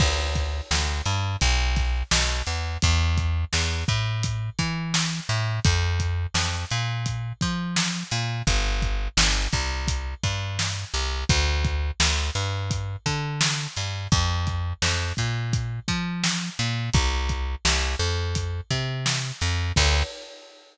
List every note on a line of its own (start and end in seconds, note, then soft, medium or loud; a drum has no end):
0.00 0.61 D2 medium
0.00 kick loud
0.00 crash loud
0.35 kick medium
0.35 closed hi-hat medium
0.71 1.02 D2 medium
0.71 snare loud
1.06 1.36 G2 medium
1.06 closed hi-hat medium
1.41 2.03 B1 medium
1.41 kick medium
1.41 closed hi-hat loud
1.76 kick loud
1.76 snare soft
1.76 closed hi-hat medium
2.11 2.42 B1 medium
2.11 snare loud
2.47 2.78 E2 medium
2.47 closed hi-hat medium
2.82 3.45 E2 medium
2.82 kick loud
2.82 closed hi-hat loud
3.17 kick medium
3.17 closed hi-hat medium
3.53 3.84 E2 medium
3.53 snare loud
3.88 4.50 A2 medium
3.88 kick loud
3.88 closed hi-hat medium
4.23 kick loud
4.23 closed hi-hat loud
4.59 5.20 E3 medium
4.59 kick medium
4.59 closed hi-hat medium
4.94 snare loud
5.29 5.60 A2 medium
5.29 closed hi-hat medium
5.65 6.26 F2 medium
5.65 kick loud
5.65 closed hi-hat loud
6.00 kick medium
6.00 closed hi-hat medium
6.34 6.65 F2 medium
6.34 snare loud
6.71 7.33 A#2 medium
6.71 closed hi-hat medium
7.06 kick medium
7.06 closed hi-hat loud
7.41 8.04 F3 medium
7.41 kick loud
7.41 closed hi-hat medium
7.76 snare loud
8.11 8.42 A#2 medium
8.11 closed hi-hat medium
8.47 9.08 G1 medium
8.47 kick loud
8.47 closed hi-hat loud
8.82 kick medium
8.82 closed hi-hat medium
9.17 9.48 G1 medium
9.17 snare loud
9.52 10.14 C2 medium
9.52 kick loud
9.52 closed hi-hat medium
9.88 kick loud
9.88 closed hi-hat loud
10.23 10.85 G2 medium
10.23 kick medium
10.23 closed hi-hat medium
10.59 snare loud
10.94 11.24 C2 medium
10.94 closed hi-hat medium
11.29 11.91 D2 medium
11.29 kick loud
11.29 closed hi-hat loud
11.65 kick loud
11.65 closed hi-hat medium
12.00 12.30 D2 medium
12.00 snare loud
12.35 12.96 G2 medium
12.35 closed hi-hat medium
12.71 kick loud
12.71 closed hi-hat loud
13.06 13.67 D3 medium
13.06 kick medium
13.06 closed hi-hat medium
13.41 snare loud
13.76 14.08 G2 medium
13.76 snare soft
13.76 closed hi-hat medium
14.12 14.73 F2 medium
14.12 kick loud
14.12 closed hi-hat loud
14.47 kick medium
14.47 closed hi-hat medium
14.82 15.13 F2 medium
14.82 snare loud
15.17 15.80 A#2 medium
15.17 kick medium
15.17 closed hi-hat medium
15.53 kick loud
15.53 closed hi-hat loud
15.88 16.50 F3 medium
15.88 kick loud
15.88 closed hi-hat medium
16.24 snare loud
16.59 16.90 A#2 medium
16.59 closed hi-hat medium
16.94 17.55 C2 medium
16.94 kick loud
16.94 closed hi-hat loud
17.29 kick medium
17.29 closed hi-hat medium
17.65 17.96 C2 medium
17.65 snare loud
17.99 18.61 F2 medium
18.35 kick medium
18.35 closed hi-hat loud
18.71 19.32 C3 medium
18.71 kick medium
18.71 closed hi-hat medium
19.06 snare loud
19.41 19.72 F2 medium
19.41 closed hi-hat medium
19.76 20.03 D2 loud
19.76 kick loud
19.76 crash loud